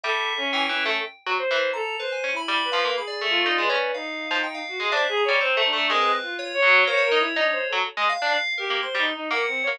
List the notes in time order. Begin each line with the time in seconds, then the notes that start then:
0.04 G3 A4 E5
0.37 C#4
0.53 E3 G5
0.69 E3 C#4
0.86 A3
1.27 F#3
1.38 C5
1.51 E3
1.73 A4 A#5
1.99 B4 C5
2.12 G#5
2.24 C#4
2.32 E4
2.36 B5
2.48 G3
2.65 B4
2.72 F3 F5
2.85 A#3
2.97 G#4 B5
3.07 D5
3.21 A3
3.30 F4
3.46 D#4
3.58 G#3 B4
3.70 C#4
3.94 D#4 F5
4.31 F3
4.43 G5
4.54 F5
4.68 F#4
4.80 G#3 G#4
4.91 D4 C5 E5
5.09 G#4
5.17 A#5
5.25 G3 C#5
5.40 C4 C5
5.57 A3
5.65 D4
5.73 A3
5.90 G#3 C4 A#4
6.01 B4
6.22 F4
6.39 C#5
6.54 C#5
6.62 F#3
6.87 A#3 C5 C#5
6.97 C#5
7.04 A#4
7.12 D#4
7.19 E4
7.36 D4 D#4
7.52 C5
7.69 F#3 A4
7.97 G#3
8.09 F5
8.22 D4
8.58 G4 A#4
8.70 A#3
8.83 C5 C6
8.95 G3 D#4
9.14 D#4
9.31 A#3 A#4 F#5
9.47 C4
9.63 C#5
9.67 A#3